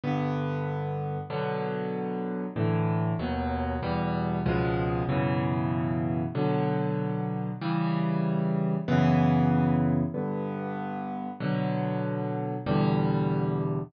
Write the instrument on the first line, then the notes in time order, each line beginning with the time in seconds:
acoustic grand piano
0.04 G2 D3 B3
1.30 B2 D3 F#3
2.56 A2 D3 E3
3.19 D#2 B2 F#3
3.83 E2 B2 G3
4.46 C#2 B2 F3 G#3
5.09 F#2 B2 C#3 E3
6.35 B2 D3 F#3
7.61 C#3 E3 G3
8.88 F#2 C#3 E3 B3
10.14 G2 D3 B3
11.40 B2 D3 F#3
12.66 E2 B2 D3 G3